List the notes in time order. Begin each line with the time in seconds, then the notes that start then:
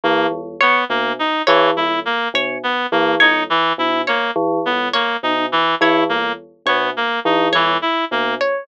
0.04 E3 A#3
0.31 E2
0.61 B3 C#5
0.89 B2 A#3
1.19 D#4
1.47 E3 C#5
1.77 E2 E4
2.05 A#3
2.34 B2 C#5
2.63 B3
2.92 E3 A#3
3.20 E2 D#4 C#5
3.50 E3
3.78 B2 E4
4.07 A#3 C#5
4.36 E3
4.66 E2 B3
4.93 A#3 C#5
5.23 B2 D#4
5.52 E3
5.81 E3 E4 C#5
6.09 E2 A#3
6.66 B2 B3 C#5
6.97 A#3
7.25 E3 D#4
7.52 E2 E3 C#5
7.82 E4
8.11 B2 A#3
8.41 C#5